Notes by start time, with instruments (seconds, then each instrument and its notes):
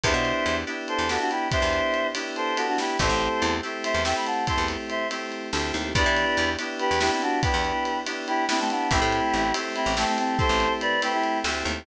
0.04 electric bass (finger) E2, electric piano 2 B3 D4 E4 G4, choir aahs C5 E5, kick, ride
0.14 electric bass (finger) B2
0.25 ride
0.46 electric bass (finger) E2, ride
0.67 electric piano 2 B3 D4 E4 G4
0.88 choir aahs A4 C5, ride
0.99 electric bass (finger) E2
1.09 electric piano 2 B3 D4 E4 G4, choir aahs F#4 A4, snare
1.20 choir aahs D4 F#4
1.31 choir aahs E4 G4, ride
1.51 electric piano 2 B3 D4 E4 G4, choir aahs C5 E5, kick, ride
1.62 electric bass (finger) E2
1.73 ride
1.94 ride
2.15 electric piano 2 B3 D4 E4 G4, ride
2.36 choir aahs A4 C5, ride
2.57 electric piano 2 B3 D4 E4 G4, choir aahs F#4 A4, ride
2.68 choir aahs D4 F#4
2.78 choir aahs E4 G4, snare
2.99 electric bass (finger) A1, electric piano 2 A3 C4 E4 G4, choir aahs A4 C5, kick, ride
3.09 electric bass (finger) A1
3.21 ride
3.42 electric bass (finger) E2, ride
3.63 electric piano 2 A3 C4 E4 G4
3.84 choir aahs C5 E5, ride
3.94 electric bass (finger) E2
4.05 electric piano 2 A3 C4 E4 G4, choir aahs E5 G5, snare
4.16 choir aahs G5 B5
4.26 choir aahs F#5 A5, ride
4.47 electric piano 2 A3 C4 E4 G4, choir aahs A5 C6, kick, ride
4.58 electric bass (finger) E2
4.68 ride
4.90 choir aahs C5 E5, ride
5.11 electric piano 2 A3 C4 E4 G4, ride
5.32 ride
5.53 electric bass (finger) D2, electric piano 2 A3 C4 E4 G4, snare
5.74 electric bass (finger) D#2, ride
5.95 electric bass (finger) E2, electric piano 2 B3 D4 E4 G4, choir aahs B4 D5, kick, ride
6.06 electric bass (finger) E3
6.17 ride
6.37 electric bass (finger) E2, ride
6.59 electric piano 2 B3 D4 E4 G4, ride
6.79 choir aahs G4 B4, ride
6.91 electric bass (finger) E2
7.01 electric piano 2 B3 D4 E4 G4, choir aahs E4 G4, snare
7.11 choir aahs C4 E4
7.22 choir aahs D4 F#4, ride
7.43 electric piano 2 B3 D4 E4 G4, choir aahs G4 B4, kick, ride
7.54 electric bass (finger) E2
7.65 ride
7.85 ride
8.06 electric piano 2 B3 D4 E4 G4, ride
8.27 choir aahs E4 G4, ride
8.49 electric piano 2 B3 D4 E4 G4, choir aahs C4 E4, snare
8.59 choir aahs A3 C4
8.70 choir aahs B3 D4, ride
8.91 electric bass (finger) A1, electric piano 2 A3 C4 E4 G4, choir aahs E4 G4, kick, ride
9.02 electric bass (finger) A2
9.12 ride
9.33 electric bass (finger) A1
9.54 electric piano 2 A3 C4 E4 G4, ride
9.75 choir aahs C4 E4, ride
9.86 electric bass (finger) A1
9.97 electric piano 2 A3 C4 E4 G4, choir aahs A3 C4, snare
10.07 choir aahs A3 C4
10.18 choir aahs A3 C4, ride
10.39 electric piano 2 A3 C4 E4 G4, choir aahs A4 C5, kick
10.49 electric bass (finger) A1
10.60 ride
10.81 choir aahs B4 D5, ride
11.02 electric piano 2 A3 C4 E4 G4, choir aahs G4 B4, ride
11.13 choir aahs E4 G4
11.23 ride
11.44 electric bass (finger) D2, electric piano 2 A3 C4 E4 G4, snare
11.65 electric bass (finger) D#2, ride